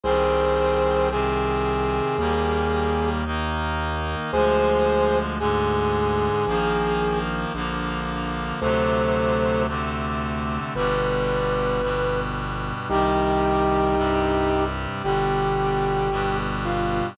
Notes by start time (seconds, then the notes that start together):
0.04 C2 D#3 G3 C4 G#4 C5
1.11 C3 D#3 C4 G#4
2.18 D#2 D#3 G3 A#3
3.25 D#3 A#3 D#4
4.32 D2 D3 F3 G#3 G#4 C5
5.40 G#2 D3 G#3 G#4
6.47 A#1 D#3 F3 A#3
7.54 A#1 D3 F3 A#3
8.61 D2 C3 D3 F#3 A3 A4 C5
9.68 C3 D3 A3 C4
10.75 G1 B2 D3 G3 B4
11.82 G2 B2 G3
12.89 C2 C3 D#3 G3 D#4 G4
13.97 G2 C3 G3
15.04 G1 B2 D3 G3 G4
16.11 G2 B2 G3
16.65 F4